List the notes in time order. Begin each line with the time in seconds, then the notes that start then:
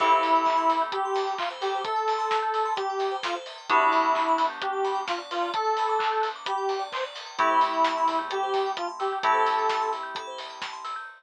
0.00 A1 C4 E4 G4 A4, kick, crash
0.12 C5
0.23 E2 E5, open hi-hat
0.35 G5
0.45 A5, kick, clap
0.57 A1 C6
0.69 A1 E6, open hi-hat
0.82 G6
0.92 G4 E6, kick, closed hi-hat
1.05 C6
1.15 A5, open hi-hat
1.27 G5
1.38 F4 E5, kick, clap
1.50 C5
1.61 G4 A4, open hi-hat
1.75 C5
1.84 A4 E5, kick, closed hi-hat
1.96 G5
2.08 A5, open hi-hat
2.18 C6
2.31 E6, kick, snare
2.42 G6
2.54 E6, open hi-hat
2.65 C6
2.76 G4 A5, kick, closed hi-hat
2.90 G5
2.99 E5, open hi-hat
3.11 C5
3.23 F4 A4, kick, snare
3.35 C5
3.46 E5, open hi-hat
3.58 G5
3.69 G1 B3 D4 E4 F#4 G4 B4, kick, closed hi-hat
3.81 D5
3.92 D2 F#5, open hi-hat
4.03 G5
4.15 B5, kick, clap
4.26 G1 D6
4.38 G1 F#6, open hi-hat
4.50 G6
4.61 G4 F#6, kick, closed hi-hat
4.73 D6
4.85 B5, open hi-hat
4.95 G5
5.08 F4 F#5, kick, snare
5.18 D5
5.31 F4 B4, open hi-hat
5.42 D5
5.54 A4 F#5, kick, closed hi-hat
5.64 G5
5.77 B5, open hi-hat
5.89 D6
5.99 F#6, kick, clap
6.12 G6
6.22 F#6, open hi-hat
6.36 D6
6.46 G4 B5, kick, closed hi-hat
6.58 G5
6.69 F#5, open hi-hat
6.79 D5
6.92 B4 C5, kick, clap
7.04 D5
7.15 F#5, open hi-hat
7.26 G5
7.38 A1 A3 C4 E4 G4 A4, kick, closed hi-hat
7.50 C5
7.61 A1 E5, open hi-hat
7.73 G5
7.84 A5, kick, snare
7.97 A1 C6
8.08 E2 E6, open hi-hat
8.19 G6
8.30 G4 A4, closed hi-hat
8.43 C5
8.54 E5, kick, open hi-hat
8.66 G5
8.77 F4 A5, kick, closed hi-hat
8.89 C6
9.00 G4 E6, open hi-hat
9.13 G6
9.23 A3 C4 E4 G4 A4, kick, closed hi-hat
9.34 C5
9.46 E5, open hi-hat
9.59 G5
9.69 A5, kick, snare
9.81 C6
9.92 E6, open hi-hat
10.03 G6
10.15 A4, kick, closed hi-hat
10.27 C5
10.38 E5, open hi-hat
10.50 G5
10.62 A5, kick, snare
10.73 C6
10.85 E6, open hi-hat
10.96 G6